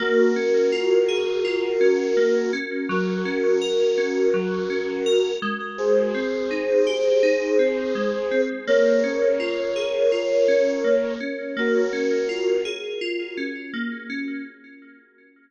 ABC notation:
X:1
M:4/4
L:1/8
Q:"Swing 16ths" 1/4=83
K:Bbm
V:1 name="Flute"
[GB]8 | [GB]8 | [Ac]8 | [Bd]8 |
[GB]3 z5 |]
V:2 name="Electric Piano 2"
B, D F A F D B, D | G, D B D G, D B A,- | A, C E =G E C A, C | B, D F A F D B, D |
B, D F A F D B, D |]